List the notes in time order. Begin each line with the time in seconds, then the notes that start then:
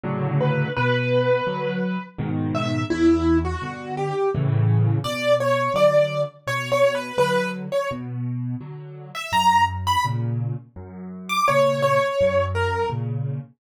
0.03 A2 C#3 D3 F#3
0.40 B4
0.76 B2 B4
1.47 D3 F#3
2.18 G#2 B2 D#3
2.55 E5
2.90 E2 E4
3.45 F#4
3.62 G2 B2 D3
3.97 G4
4.35 A2 C#3 E3
5.04 B2 D5
5.40 C#5
5.74 D3 F#3 D5
6.47 B2 C#5
6.72 C#5
6.95 B4
7.18 D3 F#3 B4
7.72 C#5
7.91 B2
8.61 D3 F#3
9.15 E5
9.32 F#2 A#5
9.87 B5
10.05 A#2 C#3
10.76 F#2
11.29 D6
11.48 A#2 C#3 C#5
11.82 C#5
12.21 F#2
12.55 A#4
12.90 A#2 C#3